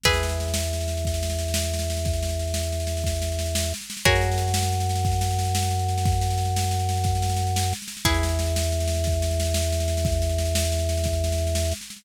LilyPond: <<
  \new Staff \with { instrumentName = "Pizzicato Strings" } { \time 12/8 \key e \lydian \tempo 4. = 120 <gis' b' e''>1.~ | <gis' b' e''>1. | <fis' gis' ais' cis''>1.~ | <fis' gis' ais' cis''>1. |
<e' gis' b'>1.~ | <e' gis' b'>1. | }
  \new Staff \with { instrumentName = "Drawbar Organ" } { \clef bass \time 12/8 \key e \lydian e,1.~ | e,1. | fis,1.~ | fis,1. |
e,1.~ | e,1. | }
  \new DrumStaff \with { instrumentName = "Drums" } \drummode { \time 12/8 <cymc bd sn>16 sn16 sn16 sn16 sn16 sn16 sn16 sn16 sn16 sn16 sn16 sn16 <bd sn>16 sn16 sn16 sn16 sn16 sn16 sn16 sn16 sn16 sn16 sn16 sn16 | <bd sn>16 sn16 sn16 sn16 sn16 sn16 sn16 sn16 sn16 sn16 sn16 sn16 <bd sn>16 sn16 sn16 sn16 sn16 sn16 sn16 sn16 sn16 sn16 sn16 sn16 | <bd sn>16 sn16 sn16 sn16 sn16 sn16 sn16 sn16 sn16 sn16 sn16 sn16 <bd sn>16 sn16 sn16 sn16 sn16 sn16 sn16 sn16 sn16 sn16 sn16 sn16 | <bd sn>16 sn16 sn16 sn16 sn16 sn16 sn16 sn16 sn16 sn16 sn16 sn16 <bd sn>16 sn16 sn16 sn16 sn16 sn16 sn16 sn16 sn16 sn16 sn16 sn16 |
<bd sn>16 sn16 sn16 sn16 sn16 sn16 sn16 sn16 sn16 sn16 sn16 sn16 <bd sn>16 sn16 sn16 sn16 sn16 sn16 sn16 sn16 sn16 sn16 sn16 sn16 | <bd sn>16 sn16 sn16 sn16 sn16 sn16 sn16 sn16 sn16 sn16 sn16 sn16 <bd sn>16 sn16 sn16 sn16 sn16 sn16 sn16 sn16 sn16 sn16 sn16 sn16 | }
>>